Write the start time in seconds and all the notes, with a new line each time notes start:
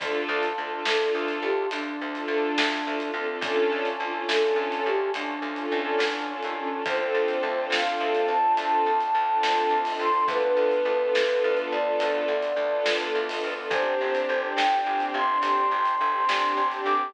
0.00 D2 D4 F4 A4, kick, closed hi-hat
0.29 D2
0.43 closed hi-hat
0.57 D2 D4 F4 A4
0.71 D4 F4 A4
0.85 D2 D4 F4 A4, snare
1.00 D4 F4 A4
1.15 D2
1.28 closed hi-hat
1.42 D2 G4
1.71 D2 D4, closed hi-hat
2.01 D2
2.15 D4 F4 A4, closed hi-hat
2.28 D2
2.58 D2, snare
2.86 D2 D4 F4 A4
3.00 D4 F4 A4, closed hi-hat
3.14 D2 C4 D4 F4 A4
3.29 D4 F4 A4
3.41 D2 C#4 D4 F4 A4, kick, closed hi-hat
3.72 D2
3.85 closed hi-hat
4.00 D2 C#4 D4 F4 A4
4.13 C#4 D4 F4 A4
4.28 D2 C#4 D4 F4 A4, snare
4.42 C#4 D4 F4 A4
4.56 D2
4.72 closed hi-hat
4.86 D2 G4
5.13 D2 D4, closed hi-hat
5.42 D2
5.56 C#4 D4 F4 A4, closed hi-hat
5.72 D2
5.99 E2, snare
6.29 C#4 D4 F4 A4
6.42 D#2 C#4 D4 F4 A4, closed hi-hat
6.56 C#4 D4 F4 A4
6.72 C#4 D4 F4 A4
6.86 D2 C4 D4 F4 A4 C5, kick, closed hi-hat
6.98 C4 D4 F4 A4
7.14 D2
7.28 closed hi-hat
7.43 D2
7.56 C4 D4 F4 A4
7.70 D2 F5, snare
7.86 C4 D4 F4 A4
8.00 D2
8.15 closed hi-hat
8.28 D2 A5
8.43 C4 D4 F4 A4
8.57 D2 A5, closed hi-hat
8.86 D2
9.01 closed hi-hat
9.15 D2
9.30 C4 D4 F4 A4
9.43 D2, snare
9.70 D2
9.85 C4 D4 F4 A4, open hi-hat
9.99 D2 C6
10.14 C4 D4 F4 A4
10.28 D2 B3 D4 F4 A4 B4, kick, closed hi-hat
10.43 B3 D4 F4 A4
10.57 D2
10.72 closed hi-hat
10.85 D2
10.99 B3 D4 F4 A4
11.15 D2, snare
11.28 B3 D4 F4 A4
11.44 D2
11.57 closed hi-hat
11.72 D2 D5
11.85 B3 D4 F4 A4
12.00 D2, closed hi-hat
12.28 D2
12.43 closed hi-hat
12.56 D2
12.71 B3 D4 F4 A4
12.86 D2, snare
13.15 D2
13.29 B3 D4 F4 A4, open hi-hat
13.44 D2
13.58 B3 D4 F4 A4
13.70 G1 C4 D4 G4 C5, kick, closed hi-hat
13.86 C4 D4 G4
14.01 G1
14.15 closed hi-hat
14.29 G1
14.42 C4 D4 G4
14.57 G1 G5, snare
14.71 C4 D4 G4
14.86 G1
15.00 closed hi-hat
15.14 G1 C6
15.29 C4 D4 G4
15.42 G1 C6, closed hi-hat
15.71 G1
15.85 closed hi-hat
16.01 G1
16.14 C4 D4 G4
16.29 G1, snare
16.57 G1
16.71 C4 D4 G4, closed hi-hat
16.85 G1 D6
17.01 C4 D4 G4